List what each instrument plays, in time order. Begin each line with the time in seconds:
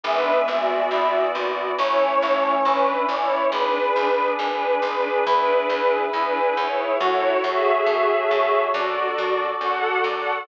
0.04 electric bass (finger) G#1, brass section E3 G#3 B3 E5, string ensemble 1 D4 B4
0.48 electric bass (finger) G#1, string ensemble 1 F#4 D5
0.91 electric bass (finger) G#1, brass section E3 B3 E4
1.35 electric bass (finger) G#1
1.78 electric bass (finger) A1, brass section E3 A3 C#4 C#5, string ensemble 1 E4 C#5
2.22 electric bass (finger) A1
2.65 electric bass (finger) A1, brass section E3 C#4 E4, string ensemble 1 D4 B4
3.08 electric bass (finger) A1, string ensemble 1 E4 C#5, brass section D5
3.52 electric bass (finger) G#1, brass section D4 G#4 B4, string ensemble 1 D4 B4
3.96 electric bass (finger) G#1
4.39 electric bass (finger) G#1, string ensemble 1 D4 B4
4.82 electric bass (finger) G#1, string ensemble 1 D4 B4
5.26 electric bass (finger) E2, string ensemble 1 D4 B4, brass section E4 G#4 B4
5.70 electric bass (finger) E2
6.12 electric bass (finger) E2, string ensemble 1 D4 B4
6.56 electric bass (finger) E2, string ensemble 1 E4 C#5
6.99 electric bass (finger) F#2, string ensemble 1 E4 C#5, brass section F#4 A4 C#5
7.44 electric bass (finger) F#2, string ensemble 1 G#4 E5
7.86 electric bass (finger) F#2
8.31 electric bass (finger) F#2
8.73 electric bass (finger) F#2, brass section D4 F#4 A4 D5, string ensemble 1 F#4 D5
9.18 electric bass (finger) F#2
9.61 electric bass (finger) F#2, brass section F#4, string ensemble 1 A4 F#5
10.04 electric bass (finger) F#2, string ensemble 1 A4 F#5, brass section D5